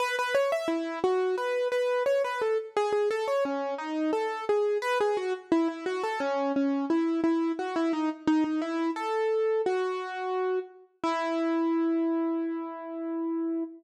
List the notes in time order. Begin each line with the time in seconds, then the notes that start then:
0.00 B4
0.19 B4
0.35 C#5
0.52 E5
0.68 E4
1.04 F#4
1.38 B4
1.72 B4
2.06 C#5
2.24 B4
2.42 A4
2.77 G#4
2.93 G#4
3.11 A4
3.28 C#5
3.45 C#4
3.78 D#4
4.13 A4
4.49 G#4
4.82 B4
5.00 G#4
5.17 F#4
5.52 E4
5.68 E4
5.86 F#4
6.03 A4
6.20 C#4
6.56 C#4
6.90 E4
7.24 E4
7.59 F#4
7.76 E4
7.93 D#4
8.27 D#4
8.44 D#4
8.61 E4
8.96 A4
9.66 F#4
11.04 E4